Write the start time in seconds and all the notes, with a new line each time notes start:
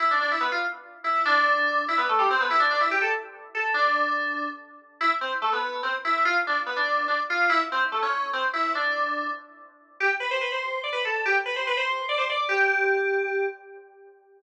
0.00 E4
0.11 D4
0.21 D4
0.31 E4
0.40 B3
0.52 F4
1.04 E4
1.25 D4
1.88 E4
1.98 B3
2.09 A3
2.19 G3
2.30 C4
2.41 B3
2.51 E4
2.60 D4
2.71 D4
2.81 E4
2.91 G4
3.02 A4
3.55 A4
3.74 D4
5.01 E4
5.21 C4
5.42 A3
5.53 B3
5.83 C4
6.05 E4
6.25 F4
6.47 D4
6.66 B3
6.76 D4
7.08 D4
7.30 F4
7.49 E4
7.72 C4
7.92 A3
8.02 C#4
8.33 C4
8.53 E4
8.75 D4
10.00 G4
10.20 B4
10.31 C5
10.41 B4
10.52 C5
10.84 D5
10.93 B4
11.05 A4
11.26 G4
11.46 B4
11.56 C5
11.67 B4
11.77 C5
12.09 D5
12.18 C5
12.30 D5
12.49 G4